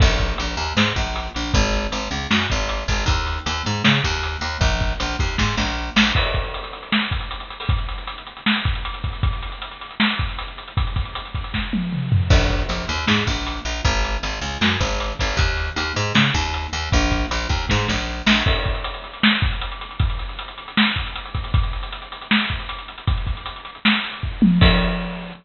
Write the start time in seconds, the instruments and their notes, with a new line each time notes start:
0.00 electric bass (finger) A#1, kick, crash
0.19 kick, closed hi-hat
0.38 electric bass (finger) A#1, closed hi-hat
0.57 electric bass (finger) D#2, closed hi-hat
0.77 electric bass (finger) G#2, snare
0.96 electric bass (finger) A#1, kick, closed hi-hat
1.16 closed hi-hat
1.34 electric bass (finger) A#1, closed hi-hat
1.53 electric bass (finger) G#1, kick, closed hi-hat
1.73 closed hi-hat
1.92 electric bass (finger) G#1, closed hi-hat
2.11 electric bass (finger) C#2, closed hi-hat
2.30 electric bass (finger) F#2, snare
2.50 electric bass (finger) G#1, kick, closed hi-hat
2.69 closed hi-hat
2.88 electric bass (finger) G#1, kick, open hi-hat
3.06 electric bass (finger) D#2, kick, closed hi-hat
3.27 closed hi-hat
3.46 electric bass (finger) D#2, closed hi-hat
3.65 electric bass (finger) G#2, closed hi-hat
3.84 electric bass (finger) C#3, snare
4.04 electric bass (finger) D#2, kick, closed hi-hat
4.23 closed hi-hat
4.41 electric bass (finger) D#2, closed hi-hat
4.61 electric bass (finger) A#1, kick, closed hi-hat
4.81 kick, closed hi-hat
5.00 electric bass (finger) A#1, closed hi-hat
5.19 electric bass (finger) D#2, kick, closed hi-hat
5.38 electric bass (finger) G#2, kick, snare
5.57 electric bass (finger) A#1, snare
5.96 electric bass (finger) A#1, snare
6.15 kick, crash
6.25 closed hi-hat
6.34 kick, closed hi-hat
6.44 closed hi-hat
6.54 closed hi-hat
6.64 closed hi-hat
6.73 closed hi-hat
6.83 closed hi-hat
6.92 snare
7.02 closed hi-hat
7.11 kick, closed hi-hat
7.21 closed hi-hat
7.31 closed hi-hat
7.40 closed hi-hat
7.50 closed hi-hat
7.60 open hi-hat
7.69 kick, closed hi-hat
7.78 closed hi-hat
7.89 closed hi-hat
7.98 closed hi-hat
8.07 closed hi-hat
8.18 closed hi-hat
8.27 closed hi-hat
8.37 closed hi-hat
8.46 snare
8.56 closed hi-hat
8.65 kick, closed hi-hat
8.75 closed hi-hat
8.85 closed hi-hat
8.94 closed hi-hat
9.04 kick, closed hi-hat
9.13 closed hi-hat
9.23 kick, closed hi-hat
9.33 closed hi-hat
9.42 closed hi-hat
9.52 closed hi-hat
9.62 closed hi-hat
9.71 closed hi-hat
9.81 closed hi-hat
9.91 closed hi-hat
10.00 snare
10.10 closed hi-hat
10.19 kick, closed hi-hat
10.29 closed hi-hat
10.39 closed hi-hat
10.48 closed hi-hat
10.58 closed hi-hat
10.68 closed hi-hat
10.77 kick, closed hi-hat
10.87 closed hi-hat
10.96 kick, closed hi-hat
11.05 closed hi-hat
11.15 closed hi-hat
11.25 closed hi-hat
11.35 kick, closed hi-hat
11.44 closed hi-hat
11.54 kick, snare
11.73 high tom
11.92 mid tom
12.12 floor tom
12.30 electric bass (finger) A#1, kick, crash
12.50 kick, closed hi-hat
12.69 electric bass (finger) A#1, closed hi-hat
12.88 electric bass (finger) D#2, closed hi-hat
13.07 electric bass (finger) G#2, snare
13.27 electric bass (finger) A#1, kick, closed hi-hat
13.47 closed hi-hat
13.65 electric bass (finger) A#1, closed hi-hat
13.85 electric bass (finger) G#1, kick, closed hi-hat
14.04 closed hi-hat
14.23 electric bass (finger) G#1, closed hi-hat
14.41 electric bass (finger) C#2, closed hi-hat
14.61 electric bass (finger) F#2, snare
14.80 electric bass (finger) G#1, kick, closed hi-hat
15.00 closed hi-hat
15.19 electric bass (finger) G#1, kick, open hi-hat
15.37 electric bass (finger) D#2, kick, closed hi-hat
15.57 closed hi-hat
15.76 electric bass (finger) D#2, closed hi-hat
15.96 electric bass (finger) G#2, closed hi-hat
16.15 electric bass (finger) C#3, snare
16.34 electric bass (finger) D#2, kick, closed hi-hat
16.54 closed hi-hat
16.73 electric bass (finger) D#2, closed hi-hat
16.92 electric bass (finger) A#1, kick, closed hi-hat
17.11 kick, closed hi-hat
17.31 electric bass (finger) A#1, closed hi-hat
17.49 electric bass (finger) D#2, kick, closed hi-hat
17.69 electric bass (finger) G#2, kick, snare
17.88 electric bass (finger) A#1, snare
18.26 electric bass (finger) A#1, snare
18.46 kick, crash
18.55 closed hi-hat
18.65 kick, closed hi-hat
18.75 closed hi-hat
18.84 closed hi-hat
18.94 closed hi-hat
19.04 closed hi-hat
19.13 closed hi-hat
19.23 snare
19.33 closed hi-hat
19.42 kick, closed hi-hat
19.52 closed hi-hat
19.61 closed hi-hat
19.72 closed hi-hat
19.81 closed hi-hat
19.91 closed hi-hat
19.99 kick, closed hi-hat
20.10 closed hi-hat
20.19 closed hi-hat
20.29 closed hi-hat
20.39 closed hi-hat
20.48 closed hi-hat
20.58 closed hi-hat
20.68 closed hi-hat
20.77 snare
20.86 closed hi-hat
20.96 kick, closed hi-hat
21.06 closed hi-hat
21.15 closed hi-hat
21.25 closed hi-hat
21.34 kick, closed hi-hat
21.44 closed hi-hat
21.54 kick, closed hi-hat
21.63 closed hi-hat
21.73 closed hi-hat
21.83 closed hi-hat
21.92 closed hi-hat
22.02 closed hi-hat
22.12 closed hi-hat
22.21 closed hi-hat
22.31 snare
22.40 closed hi-hat
22.50 kick, closed hi-hat
22.60 closed hi-hat
22.69 closed hi-hat
22.78 closed hi-hat
22.88 closed hi-hat
22.98 closed hi-hat
23.07 kick, closed hi-hat
23.17 closed hi-hat
23.27 kick, closed hi-hat
23.37 closed hi-hat
23.46 closed hi-hat
23.56 closed hi-hat
23.65 closed hi-hat
23.75 closed hi-hat
23.85 snare
23.94 closed hi-hat
24.04 closed hi-hat
24.14 closed hi-hat
24.23 kick
24.42 high tom
24.61 kick, crash